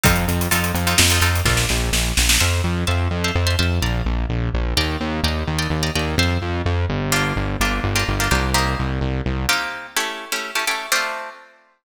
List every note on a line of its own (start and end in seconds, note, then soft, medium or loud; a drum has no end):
0.04 0.25 F2 medium
0.04 0.41 C4 medium
0.04 0.41 D#4 medium
0.04 0.41 F4 medium
0.04 0.41 A4 medium
0.04 kick loud
0.04 closed hi-hat loud
0.16 closed hi-hat medium
0.28 0.48 F2 medium
0.28 closed hi-hat medium
0.41 closed hi-hat medium
0.51 0.72 F2 medium
0.51 0.80 C4 medium
0.51 0.80 D#4 medium
0.51 0.80 F4 medium
0.51 0.80 A4 medium
0.51 closed hi-hat loud
0.64 closed hi-hat medium
0.74 0.94 F2 medium
0.74 closed hi-hat medium
0.87 1.06 C4 medium
0.87 1.06 D#4 medium
0.87 1.06 F4 medium
0.87 1.06 A4 medium
0.87 closed hi-hat medium
0.98 1.19 F2 medium
0.98 snare loud
1.10 1.21 C4 medium
1.10 1.21 D#4 medium
1.10 1.21 F4 medium
1.10 1.21 A4 medium
1.10 closed hi-hat medium
1.21 1.41 F2 medium
1.21 1.41 C4 medium
1.21 1.41 D#4 medium
1.21 1.41 F4 medium
1.21 1.41 A4 medium
1.21 closed hi-hat medium
1.35 closed hi-hat medium
1.45 1.65 A#1 medium
1.45 1.83 D4 medium
1.45 1.83 F4 medium
1.45 1.83 A4 medium
1.45 1.83 A#4 medium
1.45 kick medium
1.45 snare medium
1.57 snare medium
1.69 1.90 A#1 medium
1.69 snare medium
1.92 2.12 A#1 medium
1.92 snare loud
2.17 2.38 A#1 medium
2.17 snare loud
2.29 snare loud
2.40 2.61 F2 medium
2.40 2.78 C5 medium
2.40 2.78 E5 medium
2.40 2.78 F5 loud
2.40 2.78 A5 loud
2.64 2.84 F2 medium
2.87 3.08 F2 medium
2.87 3.16 C5 medium
2.87 3.16 E5 medium
2.87 3.16 F5 medium
2.87 3.16 A5 medium
3.11 3.31 F2 medium
3.24 3.43 C5 medium
3.24 3.43 E5 medium
3.24 3.43 F5 medium
3.24 3.43 A5 medium
3.35 3.55 F2 medium
3.47 3.56 C5 medium
3.47 3.56 E5 medium
3.47 3.56 F5 medium
3.47 3.56 A5 medium
3.59 3.79 F2 medium
3.59 3.78 C5 medium
3.59 3.78 E5 medium
3.59 3.78 F5 medium
3.59 3.78 A5 medium
3.82 4.02 A#1 medium
3.82 4.20 D5 medium
3.82 4.20 F5 medium
3.82 4.20 A#5 medium
4.05 4.25 A#1 medium
4.29 4.49 A#1 medium
4.54 4.74 A#1 medium
4.77 4.97 D#2 medium
4.77 5.15 D5 loud
4.77 5.15 D#5 loud
4.77 5.15 G5 loud
4.77 5.15 A#5 medium
5.00 5.21 D#2 medium
5.23 5.44 D#2 medium
5.23 5.53 D5 medium
5.23 5.53 D#5 medium
5.23 5.53 G5 medium
5.23 5.53 A#5 medium
5.47 5.68 D#2 medium
5.59 5.77 D5 medium
5.59 5.77 D#5 medium
5.59 5.77 G5 medium
5.59 5.77 A#5 medium
5.70 5.90 D#2 medium
5.83 5.92 D5 medium
5.83 5.92 D#5 medium
5.83 5.92 G5 medium
5.83 5.92 A#5 medium
5.95 6.15 D#2 medium
5.95 6.14 D5 medium
5.95 6.14 D#5 medium
5.95 6.14 G5 medium
5.95 6.14 A#5 medium
6.18 6.38 F2 medium
6.18 6.57 C5 medium
6.18 6.57 E5 medium
6.18 6.57 F5 medium
6.18 6.57 A5 medium
6.42 6.62 F2 medium
6.66 6.86 F2 medium
6.89 7.33 G1 medium
7.12 7.50 A#3 medium
7.12 7.50 D4 medium
7.12 7.50 F4 loud
7.12 7.50 G4 loud
7.36 7.56 G1 medium
7.60 7.80 G1 medium
7.60 7.89 A#3 medium
7.60 7.89 D4 medium
7.60 7.89 F4 medium
7.60 7.89 G4 medium
7.83 8.04 G1 medium
7.96 8.14 A#3 medium
7.96 8.14 D4 medium
7.96 8.14 F4 medium
7.96 8.14 G4 medium
8.08 8.29 G1 medium
8.20 8.29 A#3 medium
8.20 8.29 D4 medium
8.20 8.29 F4 medium
8.20 8.29 G4 medium
8.31 8.75 C2 medium
8.31 8.50 A#3 medium
8.31 8.50 D4 medium
8.31 8.50 F4 medium
8.31 8.50 G4 medium
8.54 8.92 A#3 loud
8.54 8.92 C4 medium
8.54 8.92 D#4 loud
8.54 8.92 G4 medium
8.79 8.99 C2 medium
9.01 9.21 C2 medium
9.26 9.46 C2 medium
9.49 9.87 A#3 loud
9.49 9.87 C4 medium
9.49 9.87 D#4 medium
9.49 9.87 G4 loud
9.97 10.25 A3 medium
9.97 10.25 C#4 medium
9.97 10.25 E4 medium
9.97 10.25 G4 medium
10.32 10.51 A3 medium
10.32 10.51 C#4 medium
10.32 10.51 E4 medium
10.32 10.51 G4 medium
10.55 10.65 A3 medium
10.55 10.65 C#4 medium
10.55 10.65 E4 medium
10.55 10.65 G4 medium
10.67 10.86 A3 medium
10.67 10.86 C#4 medium
10.67 10.86 E4 medium
10.67 10.86 G4 medium
10.92 11.30 A3 medium
10.92 11.30 C4 loud
10.92 11.30 D4 loud
10.92 11.30 F4 medium